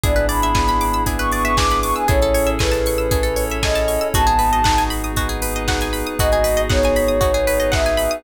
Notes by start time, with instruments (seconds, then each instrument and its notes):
0.04 synth bass 2 G#1, pad 5 (bowed) B3 D4 E4 G#4, lead 2 (sawtooth) B3 D4 E4 G#4, pizzicato strings G#4, ocarina D5, kick, closed hi-hat
0.16 pizzicato strings B4, closed hi-hat
0.29 pizzicato strings D5, ocarina B5, open hi-hat
0.42 pizzicato strings E5, closed hi-hat
0.55 lead 2 (sawtooth) B3 D4 E4 G#4, pizzicato strings G#5, kick, snare
0.68 pizzicato strings B5, closed hi-hat
0.81 pizzicato strings D6, open hi-hat
0.93 pizzicato strings E6, closed hi-hat
1.06 lead 2 (sawtooth) B3 D4 E4 G#4, pad 5 (bowed) B3 D4 G#4 B4, pizzicato strings G#4, kick, closed hi-hat
1.19 pizzicato strings B4, ocarina C#6, closed hi-hat
1.32 pizzicato strings D5, ocarina C#6, open hi-hat
1.44 pizzicato strings E5, ocarina C#6, closed hi-hat
1.56 lead 2 (sawtooth) B3 D4 E4 G#4, pizzicato strings G#5, ocarina D6, kick, snare
1.71 pizzicato strings B5, closed hi-hat
1.82 ocarina C#6, pizzicato strings D6, open hi-hat
1.96 ocarina G#5, pizzicato strings E6, closed hi-hat
2.08 synth bass 2 A1, lead 2 (sawtooth) C#4 E4 G#4 A4, pad 5 (bowed) C#4 E4 G#4 A4, pizzicato strings G#4, ocarina C#5, kick, closed hi-hat
2.22 pizzicato strings A4, closed hi-hat
2.34 pizzicato strings C#5, open hi-hat
2.47 pizzicato strings E5, closed hi-hat
2.59 lead 2 (sawtooth) C#4 E4 G#4 A4, ocarina B4, pizzicato strings G#5, kick, snare
2.72 pizzicato strings A5, closed hi-hat
2.86 pizzicato strings C#6, open hi-hat
2.98 pizzicato strings E6, closed hi-hat
3.11 lead 2 (sawtooth) C#4 E4 G#4 A4, pad 5 (bowed) C#4 E4 A4 C#5, pizzicato strings G#4, kick, closed hi-hat
3.23 pizzicato strings A4, closed hi-hat
3.36 pizzicato strings C#5, open hi-hat
3.50 pizzicato strings E5, closed hi-hat
3.63 lead 2 (sawtooth) C#4 E4 G#4 A4, ocarina D#5, pizzicato strings G#5, kick, snare
3.75 pizzicato strings A5, closed hi-hat
3.88 pizzicato strings C#6, open hi-hat
4.01 pizzicato strings E6, closed hi-hat
4.14 synth bass 2 G#1, lead 2 (sawtooth) B3 D#4 F#4 G#4, pad 5 (bowed) B3 D#4 F#4 G#4, pizzicato strings F#4, ocarina A5, kick, closed hi-hat
4.27 pizzicato strings G#4, closed hi-hat
4.39 pizzicato strings B4, open hi-hat
4.53 pizzicato strings D#5, closed hi-hat
4.64 lead 2 (sawtooth) B3 D#4 F#4 G#4, pizzicato strings F#5, kick, snare
4.78 pizzicato strings G#5, closed hi-hat
4.90 pizzicato strings B5, open hi-hat
5.04 pizzicato strings D#6, closed hi-hat
5.16 pad 5 (bowed) B3 D#4 G#4 B4, lead 2 (sawtooth) B3 D#4 F#4 G#4, pizzicato strings F#4, kick, closed hi-hat
5.29 pizzicato strings G#4, closed hi-hat
5.42 pizzicato strings B4, open hi-hat
5.55 pizzicato strings D#5, closed hi-hat
5.68 lead 2 (sawtooth) B3 D#4 F#4 G#4, pizzicato strings F#5, kick, snare
5.81 pizzicato strings G#5, closed hi-hat
5.93 pizzicato strings B5, open hi-hat
6.06 pizzicato strings D#6, closed hi-hat
6.19 synth bass 2 G#1, lead 2 (sawtooth) B3 D#4 F#4 G#4, pad 5 (bowed) B3 D#4 F#4 G#4, pizzicato strings F#4, ocarina D#5, kick, closed hi-hat
6.32 pizzicato strings G#4, closed hi-hat
6.44 pizzicato strings B4, open hi-hat
6.57 pizzicato strings D#5, closed hi-hat
6.70 lead 2 (sawtooth) B3 D#4 F#4 G#4, ocarina C#5, pizzicato strings F#5, kick, snare
6.83 pizzicato strings G#5, closed hi-hat
6.96 pizzicato strings B5, open hi-hat
7.08 pizzicato strings D#6, closed hi-hat
7.21 lead 2 (sawtooth) B3 D#4 F#4 G#4, pad 5 (bowed) B3 D#4 G#4 B4, pizzicato strings F#4, kick, closed hi-hat
7.34 pizzicato strings G#4, closed hi-hat
7.47 pizzicato strings B4, open hi-hat
7.60 pizzicato strings D#5, closed hi-hat
7.72 lead 2 (sawtooth) B3 D#4 F#4 G#4, ocarina E5, pizzicato strings F#5, kick, snare
7.86 pizzicato strings G#5, closed hi-hat
7.97 pizzicato strings B5, open hi-hat
8.11 pizzicato strings D#6, closed hi-hat